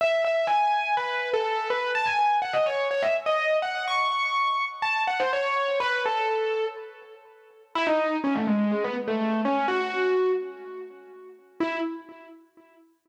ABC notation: X:1
M:4/4
L:1/16
Q:1/4=124
K:E
V:1 name="Acoustic Grand Piano"
e2 e2 g4 B3 A3 B2 | a g3 f d c2 c e z d3 f2 | c'8 a2 f ^B c4 | B2 A6 z8 |
E D3 C A, G,2 G, B, z A,3 C2 | F6 z10 | E4 z12 |]